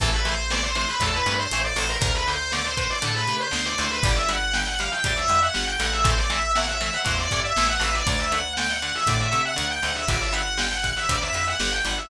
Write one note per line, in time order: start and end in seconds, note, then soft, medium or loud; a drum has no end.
0.00 0.86 A1 medium
0.00 0.11 C3 medium
0.00 0.11 E3 medium
0.00 0.11 A3 medium
0.00 0.12 A4 loud
0.00 kick loud
0.00 closed hi-hat loud
0.13 0.25 B4 medium
0.25 0.35 C3 medium
0.25 0.35 E3 medium
0.25 0.35 A3 medium
0.25 0.50 C5 loud
0.25 closed hi-hat medium
0.50 0.61 C3 medium
0.50 0.61 E3 medium
0.50 0.61 A3 medium
0.50 0.62 D5 medium
0.50 snare loud
0.63 0.75 C5 medium
0.75 0.86 C3 medium
0.75 0.86 E3 medium
0.75 0.86 A3 medium
0.75 0.88 C5 medium
0.75 closed hi-hat medium
0.88 1.00 B4 medium
1.00 1.21 E2 medium
1.00 1.12 C3 medium
1.00 1.12 E3 medium
1.00 1.12 A3 medium
1.00 1.13 A4 loud
1.00 kick medium
1.00 closed hi-hat medium
1.13 1.34 B4 medium
1.26 1.47 G2 loud
1.26 1.37 C3 medium
1.26 1.37 E3 medium
1.26 1.37 A3 medium
1.26 closed hi-hat medium
1.39 1.59 C5 medium
1.51 1.73 A1 medium
1.51 1.63 C3 medium
1.51 1.63 E3 medium
1.51 1.63 A3 medium
1.51 closed hi-hat medium
1.64 1.76 D5 medium
1.76 1.97 A1 medium
1.76 1.86 C3 medium
1.76 1.86 E3 medium
1.76 1.86 A3 medium
1.76 1.88 C5 medium
1.76 open hi-hat medium
1.89 2.01 A#4 medium
2.01 2.87 D2 loud
2.01 2.12 D3 medium
2.01 2.12 A3 medium
2.01 2.14 A#4 loud
2.01 kick loud
2.01 closed hi-hat loud
2.14 2.26 B4 medium
2.27 2.38 D3 medium
2.27 2.38 A3 medium
2.27 2.51 C5 loud
2.52 2.63 D3 medium
2.52 2.63 A3 medium
2.52 2.64 D5 loud
2.52 snare medium
2.65 2.77 C5 medium
2.77 2.88 D3 medium
2.77 2.88 A3 medium
2.77 2.89 C5 medium
2.77 kick medium
2.77 closed hi-hat medium
2.90 3.02 D5 medium
3.02 3.24 A2 medium
3.02 3.12 D3 medium
3.02 3.12 A3 medium
3.02 3.15 A4 medium
3.02 closed hi-hat medium
3.15 3.36 B4 medium
3.27 3.49 C3 medium
3.27 3.38 D3 medium
3.27 3.38 A3 medium
3.27 closed hi-hat medium
3.40 3.65 C5 loud
3.51 3.74 D2 medium
3.51 3.61 D3 medium
3.51 3.61 A3 medium
3.51 snare loud
3.65 3.77 D5 medium
3.78 4.00 D2 medium
3.78 3.89 D3 medium
3.78 3.89 A3 medium
3.78 3.90 C5 medium
3.78 closed hi-hat medium
3.91 4.03 B4 medium
4.03 4.89 G1 loud
4.03 4.15 D3 medium
4.03 4.15 G3 medium
4.03 4.15 D5 loud
4.03 kick loud
4.03 closed hi-hat medium
4.16 4.28 E5 medium
4.29 4.39 D3 medium
4.29 4.39 G3 medium
4.29 4.52 F#5 medium
4.29 closed hi-hat medium
4.53 4.65 D3 medium
4.53 4.65 G3 medium
4.53 4.66 G5 medium
4.53 snare medium
4.66 4.78 F#5 medium
4.79 4.90 D3 medium
4.79 4.90 G3 medium
4.79 4.91 F5 medium
4.79 closed hi-hat medium
4.92 5.04 G5 medium
5.04 5.27 D2 medium
5.04 5.14 D3 medium
5.04 5.14 G3 medium
5.04 5.16 D5 loud
5.04 kick medium
5.04 closed hi-hat medium
5.17 5.40 E5 medium
5.28 5.49 F2 medium
5.28 5.39 D3 medium
5.28 5.39 G3 medium
5.28 closed hi-hat medium
5.42 5.65 F#5 medium
5.54 5.77 G1 medium
5.54 5.64 D3 medium
5.54 5.64 G3 medium
5.54 snare medium
5.67 5.79 G5 loud
5.79 6.90 A1 loud
5.79 5.90 D3 medium
5.79 5.90 G3 medium
5.79 5.92 F#5 medium
5.79 closed hi-hat medium
5.92 6.04 E5 medium
6.04 6.14 C3 medium
6.04 6.14 E3 medium
6.04 6.14 A3 medium
6.04 6.17 C5 medium
6.04 kick loud
6.04 closed hi-hat loud
6.18 6.30 D5 medium
6.30 6.40 C3 medium
6.30 6.40 E3 medium
6.30 6.40 A3 medium
6.30 6.51 E5 medium
6.30 closed hi-hat medium
6.55 6.66 C3 medium
6.55 6.66 E3 medium
6.55 6.66 A3 medium
6.55 6.68 F#5 medium
6.55 snare medium
6.68 6.80 E5 medium
6.81 6.91 C3 medium
6.81 6.91 E3 medium
6.81 6.91 A3 medium
6.81 6.93 E5 medium
6.81 closed hi-hat medium
6.93 7.05 F#5 medium
7.05 7.28 E2 medium
7.05 7.15 C3 medium
7.05 7.15 E3 medium
7.05 7.15 A3 medium
7.05 7.18 C5 medium
7.05 kick medium
7.05 closed hi-hat medium
7.18 7.40 D5 medium
7.31 7.53 G2 medium
7.31 7.42 C3 medium
7.31 7.42 E3 medium
7.31 7.42 A3 medium
7.31 kick medium
7.31 closed hi-hat medium
7.44 7.66 E5 medium
7.56 7.78 A1 medium
7.56 7.68 C3 medium
7.56 7.68 E3 medium
7.56 7.68 A3 medium
7.56 snare loud
7.69 7.81 F#5 medium
7.80 8.02 A1 medium
7.80 7.90 C3 medium
7.80 7.90 E3 medium
7.80 7.90 A3 medium
7.80 7.93 E5 medium
7.80 closed hi-hat medium
7.94 8.06 D5 medium
8.07 8.92 D2 medium
8.07 8.17 D3 medium
8.07 8.17 A3 medium
8.07 8.19 D5 loud
8.07 kick medium
8.07 closed hi-hat medium
8.19 8.31 E5 medium
8.32 8.42 D3 medium
8.32 8.42 A3 medium
8.32 8.53 F#5 medium
8.32 closed hi-hat medium
8.57 8.68 D3 medium
8.57 8.68 A3 medium
8.57 8.69 G5 medium
8.57 snare loud
8.70 8.82 F#5 medium
8.82 8.92 D3 medium
8.82 8.92 A3 medium
8.82 8.94 F#5 medium
8.82 closed hi-hat medium
8.95 9.07 E5 medium
9.07 9.28 A2 medium
9.07 9.18 D3 medium
9.07 9.18 A3 medium
9.07 9.19 D5 medium
9.07 kick medium
9.07 closed hi-hat medium
9.20 9.42 E5 medium
9.32 9.54 C3 medium
9.32 9.42 D3 medium
9.32 9.42 A3 medium
9.32 closed hi-hat medium
9.45 9.67 F#5 medium
9.56 9.80 D2 medium
9.56 9.66 D3 medium
9.56 9.66 A3 medium
9.56 closed hi-hat medium
9.71 9.83 G5 medium
9.82 10.05 D2 medium
9.82 9.93 D3 medium
9.82 9.93 A3 medium
9.82 9.95 F#5 medium
9.82 closed hi-hat medium
9.96 10.08 E5 medium
10.08 10.93 G1 medium
10.08 10.19 D3 medium
10.08 10.19 G3 medium
10.08 10.20 D5 medium
10.08 kick medium
10.08 closed hi-hat medium
10.21 10.33 E5 medium
10.32 10.43 D3 medium
10.32 10.43 G3 medium
10.32 10.57 F#5 medium
10.32 closed hi-hat medium
10.57 10.68 D3 medium
10.57 10.68 G3 medium
10.57 10.71 G5 medium
10.57 snare loud
10.71 10.83 F#5 medium
10.83 10.93 D3 medium
10.83 10.93 G3 medium
10.83 10.96 F#5 loud
10.83 kick medium
10.83 closed hi-hat medium
10.97 11.09 E5 medium
11.09 11.30 D2 medium
11.09 11.19 D3 medium
11.09 11.19 G3 medium
11.09 11.21 D5 medium
11.09 kick medium
11.09 closed hi-hat loud
11.22 11.45 E5 loud
11.33 11.54 F2 medium
11.33 11.45 D3 medium
11.33 11.45 G3 medium
11.33 closed hi-hat medium
11.47 11.71 F#5 medium
11.60 11.81 G1 medium
11.60 11.70 D3 medium
11.60 11.70 G3 medium
11.60 snare loud
11.72 11.84 G5 medium
11.85 12.06 G1 medium
11.85 11.96 D3 medium
11.85 11.96 G3 medium
11.85 11.97 F#5 medium
11.85 closed hi-hat medium
11.97 12.09 E5 medium